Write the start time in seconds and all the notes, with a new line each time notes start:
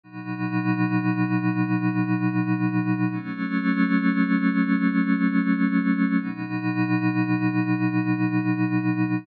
0.04 B2 F#3 D#4
3.11 F#3 A3 C#4
6.19 B2 F#3 D#4